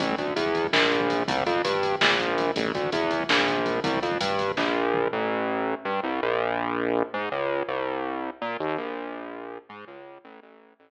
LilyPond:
<<
  \new Staff \with { instrumentName = "Synth Bass 1" } { \clef bass \time 7/8 \key a \phrygian \tempo 4 = 164 a,,8 d,8 e,4 bes,,4. | c,8 f,8 g,4 bes,,4. | a,,8 d,8 e,4 bes,,4. | c,8 f,8 g,4 bes,,4. |
a,,2 g,8 c,8 bes,,8~ | bes,,2 gis,8 des,4 | c,2 bes,8 ees,8 bes,,8~ | bes,,2 gis,8 des,4 |
a,,8 a,,4 a,,4 r4 | }
  \new DrumStaff \with { instrumentName = "Drums" } \drummode { \time 7/8 <hh bd>16 bd16 <hh bd>16 bd16 <hh bd>16 bd16 <hh bd>16 bd16 <bd sn>16 bd16 <hh bd>16 bd16 <hh bd>16 bd16 | <hh bd>16 bd16 <hh bd>16 bd16 <hh bd>16 bd16 <hh bd>16 bd16 <bd sn>16 bd16 <hh bd>16 bd16 <hh bd>16 bd16 | <hh bd>16 bd16 <hh bd>16 bd16 <hh bd>16 bd16 <hh bd>16 bd16 <bd sn>16 bd16 <hh bd>16 bd16 <hh bd>16 bd16 | <hh bd>16 bd16 <hh bd>16 bd16 <hh bd>16 bd16 <hh bd>16 bd16 <bd sn>4 toml8 |
r4 r4 r4. | r4 r4 r4. | r4 r4 r4. | r4 r4 r4. |
r4 r4 r4. | }
>>